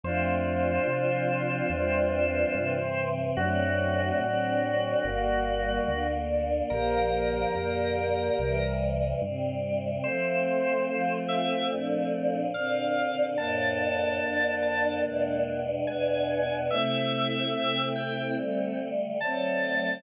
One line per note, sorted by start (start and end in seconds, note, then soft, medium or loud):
0.03 0.79 F2 medium
0.03 0.86 F3 medium
0.03 0.86 A3 medium
0.03 0.86 C4 medium
0.03 2.74 D4 medium
0.03 2.74 F4 loud
0.03 3.08 C5 loud
0.87 1.62 C3 medium
0.87 1.70 F3 medium
0.87 1.70 C4 medium
0.87 1.70 F4 medium
1.70 2.45 E2 medium
1.70 2.52 E3 medium
1.70 2.53 G3 medium
1.70 2.52 C4 medium
2.53 3.29 G2 medium
2.53 3.35 C3 medium
2.53 3.35 E3 medium
2.53 3.35 C4 medium
3.37 4.12 F#2 medium
3.37 4.20 D3 medium
3.37 4.20 F#3 medium
3.37 4.21 A3 medium
3.37 4.20 C4 medium
3.37 4.18 D4 medium
3.37 6.07 F#4 loud
3.37 4.18 F#4 loud
4.20 4.95 A2 medium
4.20 5.03 D3 medium
4.20 5.03 F#3 medium
4.20 5.03 C4 medium
4.20 5.03 D4 medium
5.03 5.80 G1 medium
5.03 5.86 D3 medium
5.03 5.86 G3 medium
5.03 5.86 A#3 medium
5.03 6.07 A#4 medium
5.87 6.62 D2 medium
5.87 6.69 D3 medium
5.87 6.69 A#3 medium
5.87 6.69 D4 medium
6.29 6.65 D5 medium
6.70 7.46 A#1 medium
6.70 7.53 D3 medium
6.70 7.53 F3 medium
6.70 7.53 A#3 medium
6.70 8.53 G4 medium
6.70 8.73 A#4 loud
6.70 8.53 A#4 loud
7.53 8.30 F2 medium
7.53 8.36 A#2 medium
7.53 8.36 D3 medium
7.53 8.36 A#3 medium
8.37 9.14 C2 medium
8.37 9.20 C3 medium
8.37 9.20 E3 medium
8.37 9.20 G3 medium
9.21 9.97 G2 medium
9.21 10.03 C3 medium
9.21 10.03 G3 medium
9.21 10.03 C4 medium
10.04 10.87 F3 medium
10.04 12.37 A3 loud
10.04 10.87 A3 medium
10.04 12.37 C4 loud
10.04 10.87 C4 medium
10.04 11.12 C5 loud
10.89 11.69 F3 medium
10.89 11.71 C4 medium
10.89 11.71 F4 medium
11.28 11.67 E5 loud
11.69 12.52 A#2 medium
11.69 12.52 F3 medium
11.69 12.52 D4 medium
12.54 13.37 A#2 medium
12.54 13.37 D3 medium
12.54 13.28 C4 medium
12.54 13.37 D4 medium
12.54 13.25 F5 medium
13.37 14.20 F2 medium
13.37 14.20 A2 medium
13.37 15.59 A#3 medium
13.37 15.59 D4 medium
13.37 14.20 D4 medium
13.37 14.55 A5 loud
14.20 15.03 F2 medium
14.20 15.03 D3 medium
14.20 15.03 D4 medium
14.62 15.01 A5 loud
15.04 15.87 E2 medium
15.04 15.87 B2 medium
15.04 15.87 G#3 medium
15.04 15.87 D4 medium
15.87 16.71 E2 medium
15.87 16.71 B2 medium
15.87 16.71 B3 medium
15.87 16.67 D4 medium
15.87 16.71 D4 medium
15.87 16.55 G#5 loud
16.70 17.53 C3 medium
16.70 17.53 A3 medium
16.70 18.82 A3 loud
16.70 18.82 C4 loud
16.70 17.53 E4 medium
16.70 17.82 E5 loud
17.53 18.36 C3 medium
17.53 18.36 C4 medium
17.53 18.36 E4 medium
17.96 18.34 G5 loud
18.36 19.18 D3 medium
18.36 19.18 G3 medium
18.36 19.18 A3 medium
19.20 20.02 D3 medium
19.20 20.02 F#3 medium
19.20 20.02 A3 medium
19.20 20.00 C4 medium
19.20 20.02 A5 loud